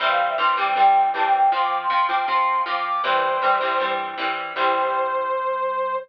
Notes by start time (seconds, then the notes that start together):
0.00 C2 E3 G3 C4 E5
0.09 F5
0.29 E5
0.38 C2 E3 G3 C4 C6
0.57 E3 G3 C4 D6
0.76 G2 E3 G3 C4 G5
1.14 C2 E3 G3 C4 A5
1.23 G5
1.33 G5
1.52 F2 F3 C4 C6
1.62 D6
1.81 C6
1.90 F2 F3 C4 C6
2.09 F3 C4 D6
2.27 C3 F3 C4 C6
2.66 F2 F3 C4 D6
2.76 D6
2.85 D6
3.03 E2 E3 G3 C4 C5
3.42 E2 E3 G3 C4
3.61 E3 G3 C4
3.80 G2 E3 G3 C4
4.18 E2 E3 G3 C4
4.55 C2 E3 G3 C4 C5